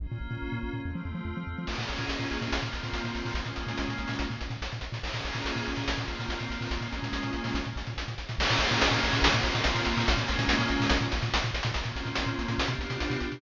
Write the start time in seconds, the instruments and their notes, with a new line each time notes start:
0.00 synth bass 1 A#1, pad 5 (bowed) A#3 C#4 F4
0.12 synth bass 1 A#2
0.21 synth bass 1 A#1
0.31 synth bass 1 A#2
0.42 synth bass 1 A#1
0.52 synth bass 1 A#2
0.63 synth bass 1 A#1
0.73 synth bass 1 A#2
0.83 synth bass 1 F2, pad 5 (bowed) A3 C4 F4
0.95 synth bass 1 F3
1.05 synth bass 1 F2
1.15 synth bass 1 F3
1.25 synth bass 1 F2
1.37 synth bass 1 F3
1.47 synth bass 1 F2
1.58 synth bass 1 F3
1.67 synth bass 1 A#1, pad 5 (bowed) A#3 C#4 F4 G#4, crash
1.78 synth bass 1 A#2, closed hi-hat
1.88 synth bass 1 A#1, closed hi-hat
1.98 synth bass 1 A#2, closed hi-hat
2.09 synth bass 1 A#1, closed hi-hat
2.19 synth bass 1 A#2, closed hi-hat
2.31 synth bass 1 A#1, closed hi-hat
2.41 synth bass 1 A#2, closed hi-hat
2.52 synth bass 1 A#1, pad 5 (bowed) A#3 C4 F4, closed hi-hat
2.62 synth bass 1 A#2, closed hi-hat
2.73 synth bass 1 A#1, closed hi-hat
2.83 synth bass 1 A#2, closed hi-hat
2.93 synth bass 1 A#1, closed hi-hat
3.04 synth bass 1 A#2, closed hi-hat
3.15 synth bass 1 A#1, closed hi-hat
3.25 synth bass 1 A#2, open hi-hat
3.34 synth bass 1 A#1, pad 5 (bowed) G#3 A#3 C#4 F4, closed hi-hat
3.45 synth bass 1 A#2, closed hi-hat
3.56 synth bass 1 A#1, closed hi-hat
3.67 synth bass 1 A#2, closed hi-hat
3.78 synth bass 1 A#1, closed hi-hat
3.88 synth bass 1 A#2, closed hi-hat
3.98 synth bass 1 A#1, closed hi-hat
4.08 synth bass 1 A#2, open hi-hat
4.19 synth bass 1 A#1, closed hi-hat
4.30 synth bass 1 A#2, closed hi-hat
4.41 synth bass 1 A#1, closed hi-hat
4.50 synth bass 1 A#2, closed hi-hat
4.62 synth bass 1 A#1, closed hi-hat
4.72 synth bass 1 A#2, closed hi-hat
4.81 synth bass 1 A#1, closed hi-hat
4.92 synth bass 1 A#2, closed hi-hat
5.03 synth bass 1 A#1, pad 5 (bowed) A#3 C#4 F4 G#4, crash
5.14 synth bass 1 A#2, closed hi-hat
5.25 synth bass 1 A#1, closed hi-hat
5.34 synth bass 1 A#2, closed hi-hat
5.45 synth bass 1 A#1, closed hi-hat
5.56 synth bass 1 A#2, closed hi-hat
5.66 synth bass 1 A#1, closed hi-hat
5.76 synth bass 1 A#2, closed hi-hat
5.88 synth bass 1 A#1, pad 5 (bowed) A#3 C4 F4, closed hi-hat
5.98 synth bass 1 A#2, closed hi-hat
6.08 synth bass 1 A#1, closed hi-hat
6.19 synth bass 1 A#2, closed hi-hat
6.29 synth bass 1 A#1, closed hi-hat
6.39 synth bass 1 A#2, closed hi-hat
6.50 synth bass 1 A#1, closed hi-hat
6.61 synth bass 1 A#2, open hi-hat
6.71 synth bass 1 A#1, pad 5 (bowed) G#3 A#3 C#4 F4, closed hi-hat
6.81 synth bass 1 A#2, closed hi-hat
6.93 synth bass 1 A#1, closed hi-hat
7.02 synth bass 1 A#2, closed hi-hat
7.13 synth bass 1 A#1, closed hi-hat
7.23 synth bass 1 A#2, closed hi-hat
7.33 synth bass 1 A#1, closed hi-hat
7.44 synth bass 1 A#2, open hi-hat
7.54 synth bass 1 A#1, closed hi-hat
7.64 synth bass 1 A#2, closed hi-hat
7.76 synth bass 1 A#1, closed hi-hat
7.87 synth bass 1 A#2, closed hi-hat
7.97 synth bass 1 A#1, closed hi-hat
8.08 synth bass 1 A#2, closed hi-hat
8.18 synth bass 1 A#1, closed hi-hat
8.29 synth bass 1 A#2, closed hi-hat
8.38 synth bass 1 A#1, pad 5 (bowed) A#3 C#4 F4 G#4, crash
8.50 synth bass 1 A#2, closed hi-hat
8.59 synth bass 1 A#1, closed hi-hat
8.71 synth bass 1 A#2, closed hi-hat
8.81 synth bass 1 A#1, closed hi-hat
8.91 synth bass 1 A#2, closed hi-hat
9.03 synth bass 1 A#1, closed hi-hat
9.13 synth bass 1 A#2, closed hi-hat
9.22 synth bass 1 A#1, pad 5 (bowed) A#3 C4 F4, closed hi-hat
9.33 synth bass 1 A#2, closed hi-hat
9.43 synth bass 1 A#1, closed hi-hat
9.55 synth bass 1 A#2, closed hi-hat
9.64 synth bass 1 A#1, closed hi-hat
9.75 synth bass 1 A#2, closed hi-hat
9.85 synth bass 1 A#1, closed hi-hat
9.97 synth bass 1 A#2, open hi-hat
10.06 synth bass 1 A#1, pad 5 (bowed) G#3 A#3 C#4 F4, closed hi-hat
10.17 synth bass 1 A#2, closed hi-hat
10.28 synth bass 1 A#1, closed hi-hat
10.39 synth bass 1 A#2, closed hi-hat
10.48 synth bass 1 A#1, closed hi-hat
10.59 synth bass 1 A#2, closed hi-hat
10.68 synth bass 1 A#1, closed hi-hat
10.80 synth bass 1 A#2, open hi-hat
10.90 synth bass 1 A#1, closed hi-hat
11.01 synth bass 1 A#2, closed hi-hat
11.12 synth bass 1 A#1, closed hi-hat
11.22 synth bass 1 A#2, closed hi-hat
11.34 synth bass 1 A#1, closed hi-hat
11.43 synth bass 1 A#2, closed hi-hat
11.54 synth bass 1 A#1, closed hi-hat
11.63 synth bass 1 A#2, closed hi-hat
11.74 synth bass 1 A#1, pad 5 (bowed) A#3 C4 C#4 F4, closed hi-hat
11.84 synth bass 1 A#2, closed hi-hat
11.96 synth bass 1 A#1, closed hi-hat
12.05 synth bass 1 A#2, closed hi-hat
12.15 synth bass 1 A#1, closed hi-hat
12.26 synth bass 1 A#2, closed hi-hat
12.39 synth bass 1 A#1, closed hi-hat
12.48 synth bass 1 A#2, closed hi-hat
12.58 synth bass 1 B1, pad 5 (bowed) B3 D4 F4 G4, closed hi-hat
12.67 synth bass 1 B2, closed hi-hat
12.79 synth bass 1 B1, closed hi-hat
12.90 synth bass 1 B2, closed hi-hat
13.00 synth bass 1 B1, closed hi-hat
13.10 synth bass 1 B2, closed hi-hat
13.20 synth bass 1 B1, closed hi-hat
13.32 synth bass 1 B2, closed hi-hat